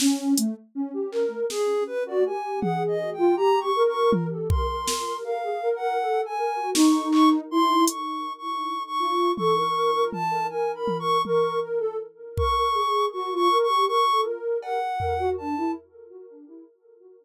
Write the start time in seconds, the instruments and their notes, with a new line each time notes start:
0.00 ocarina C#4, snare
0.37 ocarina A3, closed hi-hat
0.75 ocarina C#4
0.94 ocarina G4
1.12 ocarina A#4, clap
1.50 ocarina G#4, snare
1.87 ocarina B4
2.06 ocarina F#4 D5
2.26 ocarina G4 G#5
2.60 ocarina G#4 F#5, high tom
2.88 ocarina D#5
3.13 ocarina G5
3.18 ocarina F4
3.36 ocarina G4 A#5
3.60 ocarina C#6
3.76 ocarina A#4
3.89 ocarina C#6
4.12 high tom
4.31 ocarina A4
4.49 ocarina A#4 C6, kick
4.70 ocarina A#4
4.87 ocarina A#4, snare
5.07 ocarina A#4
5.24 ocarina A#4 F5
5.43 ocarina G#4
5.63 ocarina A#4
5.76 ocarina F#5
5.81 ocarina A#4
6.00 ocarina A4
6.25 ocarina G#5
6.38 ocarina A#4
6.56 ocarina F#4
6.74 ocarina D#4 C#6, snare
7.12 ocarina C#6, clap
7.51 ocarina E4 C6
7.88 ocarina C#6, closed hi-hat
8.38 ocarina C#6
8.87 ocarina C#6
8.99 ocarina F4
9.37 ocarina A4 C#6, high tom
9.56 ocarina A#4
9.74 ocarina A#4
9.95 ocarina A#4
10.12 ocarina A5, high tom
10.30 ocarina A#4
10.49 ocarina A#4 G#5
10.75 ocarina B5
10.88 high tom
11.00 ocarina C#6
11.25 ocarina A#4 C#6, high tom
11.62 ocarina A#4
11.80 ocarina A4
12.37 ocarina A#4 C#6, kick
12.57 ocarina A#4
12.74 ocarina G#4
13.12 ocarina F#4 C#6
13.31 ocarina F4
13.35 ocarina C#6
13.51 ocarina A#4
13.63 ocarina C#6
13.69 ocarina G4
13.87 ocarina A#4 C#6
14.08 ocarina A4
14.25 ocarina A#4
14.62 ocarina A#4 F#5, cowbell
14.99 ocarina A#4, floor tom
15.19 ocarina F#4
15.38 ocarina D4 A5
15.58 ocarina E4